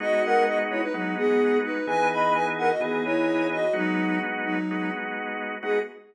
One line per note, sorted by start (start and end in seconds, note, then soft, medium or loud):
0.00 0.84 G#3 loud
0.00 0.84 B3 loud
0.00 0.84 D#4 loud
0.00 0.22 F#4 loud
0.00 0.84 F#4 loud
0.00 0.22 D#5 loud
0.24 0.44 A#4 medium
0.24 0.44 F#5 loud
0.47 0.58 F#4 medium
0.47 0.58 D#5 medium
0.70 0.81 E4 medium
0.70 0.81 C#5 medium
0.82 0.93 D#4 medium
0.82 0.93 B4 medium
0.94 1.15 F#3 medium
0.94 1.78 G#3 medium
0.94 1.78 B3 medium
0.94 1.15 D#4 medium
0.94 1.78 D#4 medium
0.94 1.78 F#4 medium
1.17 1.58 B3 medium
1.17 1.58 G#4 loud
1.64 1.86 D#4 medium
1.64 1.86 B4 medium
1.87 2.71 E3 loud
1.87 2.71 B3 loud
1.87 2.71 D#4 loud
1.87 2.71 G#4 loud
1.87 2.08 B4 medium
1.87 2.08 G#5 loud
2.11 2.33 D#5 medium
2.11 2.33 B5 medium
2.35 2.46 B4 medium
2.35 2.46 G#5 medium
2.58 2.69 A#4 medium
2.58 2.69 F#5 loud
2.70 2.81 F#4 medium
2.70 2.81 D#5 medium
2.80 3.65 E3 medium
2.80 3.65 B3 medium
2.80 3.04 B3 medium
2.80 3.65 D#4 medium
2.80 3.65 G#4 loud
2.80 3.04 G#4 medium
3.05 3.47 E4 medium
3.05 3.47 C#5 medium
3.52 3.73 F#4 medium
3.52 3.73 D#5 medium
3.73 4.19 F#3 medium
3.73 4.58 G#3 loud
3.73 4.58 B3 loud
3.73 4.58 D#4 loud
3.73 4.19 D#4 loud
3.73 4.58 F#4 loud
4.45 4.91 F#3 medium
4.45 4.91 D#4 medium
4.71 5.55 G#3 loud
4.71 5.55 B3 medium
4.71 5.55 D#4 medium
4.71 5.55 F#4 medium
5.62 5.79 G#3 loud
5.62 5.79 B3 loud
5.62 5.79 D#4 loud
5.62 5.79 F#4 loud
5.62 5.79 G#4 loud